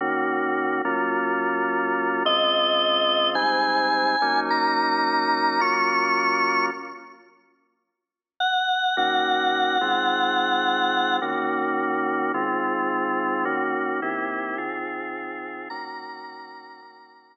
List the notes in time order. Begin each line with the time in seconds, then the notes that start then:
0.01 D#3 A#3 C#4 F#4
0.85 F#3 A#3 C#4 F4
2.25 C#3 G#3 C4 F4 D#5
3.35 G#2 G3 C4 D#4 G#5
4.22 F#3 A#3 C#4 D#4
4.50 A#5
5.60 F#3 A#3 C#4 F4 C#6
8.40 F#5
8.97 D#3 A#3 C#4 F#4 F#5
9.81 D#3 G#3 C4 F4
11.21 D#3 A#3 C#4 F#4
12.34 D#3 G#3 C4 F4
13.45 D#3 A#3 C#4 F#4
14.02 D#3 A#3 C4 E4 G4
14.58 D#3 C4 F4 G#4
15.70 D#3 A#3 C#4 F#4 A#5
16.82 D#3 A#3 C#4 F#4